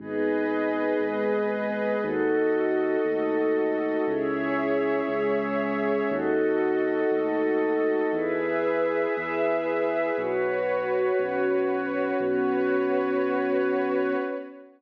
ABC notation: X:1
M:6/8
L:1/8
Q:3/8=59
K:Bmix
V:1 name="Pad 5 (bowed)"
[B,DG]3 [G,B,G]3 | [DFA]3 [A,DA]3 | [CEG]3 [G,CG]3 | [DFA]3 [A,DA]3 |
[EGB]3 [EBe]3 | [FBc]3 [CFc]3 | [B,CF]6 |]
V:2 name="Pad 2 (warm)"
[GBd]6 | [FAd]6 | [Gce]6 | [FAd]6 |
[GBe]6 | [FBc]6 | [FBc]6 |]
V:3 name="Synth Bass 2" clef=bass
G,,,3 G,,,3 | D,,3 D,,3 | C,,3 C,,3 | D,,3 D,,3 |
E,,3 E,,3 | B,,,3 B,,,3 | B,,,6 |]